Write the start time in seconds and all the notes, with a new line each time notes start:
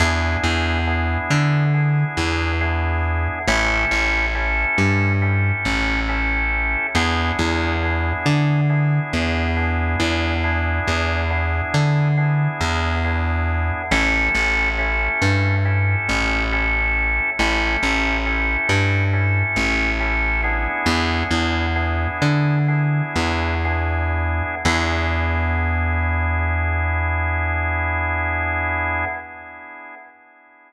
0.00 E2 B3 D4 E4 G#4
0.44 E2
0.87 B3 D4 E4 G#4
1.30 D3
1.74 B3 D4 E4 G#4
2.17 E2
2.61 B3 D4 E4 G#4
3.48 A1 C#4 E4 G4 A4
3.91 A1
4.35 C#4 E4 G4 A4
4.78 G2
5.22 C#4 E4 G4 A4
5.65 A1
6.09 C#4 E4 G4 A4
6.95 E2 B3 D4 E4 G#4
7.39 E2
7.83 B3 D4 E4 G#4
8.26 D3
8.70 B3 D4 E4 G#4
9.13 E2
9.57 B3 D4 E4 G#4
10.00 E2
10.44 B3 D4 E4 G#4
10.87 E2
11.30 B3 D4 E4 G#4
11.74 D3
12.17 B3 D4 E4 G#4
12.61 E2
13.04 B3 D4 E4 G#4
13.91 A1 C#4 E4 G4 A4
14.35 A1
14.78 C#4 E4 G4 A4
15.22 G2
15.65 C#4 E4 G4 A4
16.09 A1
16.52 C#4 E4 G4 A4
17.39 A1 C#4 E4 G4 A4
17.83 A1
18.26 C#4 E4 G4 A4
18.69 G2
19.13 C#4 E4 G4 A4
19.56 A1
20.00 C#4 E4 G4 A4
20.43 B3 D4 E4 G#4
20.86 E2
21.31 E2
21.76 B3 D4 E4 G#4
22.22 D3
22.68 B3 D4 E4 G#4
23.16 E2
23.65 B3 D4 E4 G#4
24.65 E2 B3 D4 E4 G#4